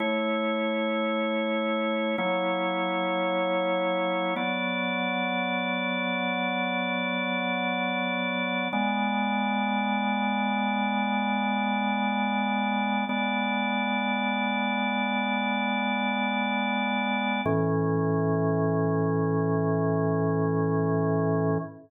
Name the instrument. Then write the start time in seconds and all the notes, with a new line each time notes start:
drawbar organ
0.00 A3 E4 C#5
2.18 F#3 A#3 E4 C#5
4.36 F#3 B3 D5
8.73 G#3 B3 D5
13.09 G#3 B3 D5
17.45 A2 E3 C#4